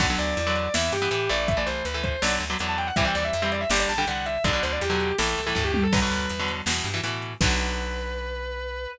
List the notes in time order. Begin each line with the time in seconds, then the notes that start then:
0.00 B1 D3 F#3 B3 F#5, kick, crash
0.10 D3 F#3 B3
0.18 D2 D5, closed hi-hat
0.37 E2, closed hi-hat
0.47 D3 F#3 B3
0.56 D5, closed hi-hat
0.74 E2 E3 B3 E5, snare
0.92 G2 G4, closed hi-hat
1.02 E3 B3
1.11 A2 E3 B3, closed hi-hat
1.29 A1 E3 A3 D5, closed hi-hat
1.48 E5, kick, closed hi-hat
1.57 E3 A3 D5
1.66 C2 C5, closed hi-hat
1.85 D2 B4, closed hi-hat
1.94 E3 A3 B4
2.04 C5, kick, closed hi-hat
2.22 B1 D3 F#3 B3 D5, snare
2.40 D2, closed hi-hat
2.50 D3 F#3 B3
2.59 E2 D3 F#3 B3, closed hi-hat
2.69 A5
2.78 G5, closed hi-hat
2.87 F#5
2.96 C2 E3 G3 C4 E5, kick, closed hi-hat
3.05 E3 G3 C4 G5
3.15 D#2 D5, closed hi-hat
3.25 E5
3.33 F2 E5, closed hi-hat
3.42 E3 G3 C4 E5
3.52 D5, closed hi-hat
3.61 E5
3.70 G1 D3 G3 D5, snare
3.80 D5
3.89 A#1 A5, closed hi-hat
3.98 D3 G3 G5
4.07 C2 D3 G3 F#5, closed hi-hat
4.26 E5, closed hi-hat
4.44 B1 B2 D3 F#3 D5, kick, closed hi-hat
4.53 B2 D3 F#3
4.63 D2 C5, closed hi-hat
4.72 D5
4.81 E2 G4, closed hi-hat
4.90 B2 D3 F#3
5.00 closed hi-hat
5.18 A1 A2 E3 A4, snare
5.37 C2, closed hi-hat
5.47 A2 E3 A4
5.55 D2 A2 E3, kick, floor tom
5.65 G4
5.74 high tom
5.83 A4
5.92 B1 B2 D3 F#3 B4, kick, crash
6.02 B2 D3 F#3
6.11 D2, closed hi-hat
6.30 E2, closed hi-hat
6.40 B2 D3 F#3
6.48 closed hi-hat
6.66 E2 B2 E3, snare
6.84 G2, closed hi-hat
6.94 B2 E3
7.03 A2 B2 E3, closed hi-hat
7.22 closed hi-hat
7.41 B1 D3 F#3 B3 B4, kick, crash